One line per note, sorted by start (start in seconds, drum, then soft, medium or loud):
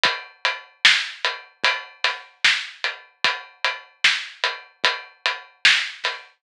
0.04 kick loud
0.04 closed hi-hat loud
0.45 closed hi-hat medium
0.85 snare loud
1.25 closed hi-hat medium
1.64 kick medium
1.64 closed hi-hat loud
2.04 snare soft
2.04 closed hi-hat medium
2.45 snare loud
2.84 closed hi-hat medium
3.25 kick loud
3.25 closed hi-hat loud
3.65 closed hi-hat medium
4.04 snare loud
4.44 closed hi-hat medium
4.84 kick medium
4.84 closed hi-hat loud
5.26 closed hi-hat medium
5.65 snare loud
6.04 snare soft
6.04 closed hi-hat medium